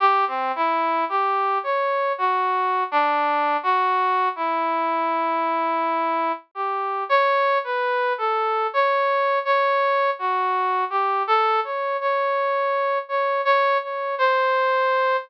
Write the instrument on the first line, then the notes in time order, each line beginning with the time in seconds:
brass section
0.00 G4
0.27 C4
0.55 E4
1.09 G4
1.63 C#5
2.18 F#4
2.91 D4
3.63 F#4
4.36 E4
6.55 G4
7.09 C#5
7.64 B4
8.18 A4
8.73 C#5
9.45 C#5
10.19 F#4
10.90 G4
11.27 A4
11.64 C#5
12.00 C#5
13.09 C#5
13.45 C#5
13.82 C#5
14.18 C5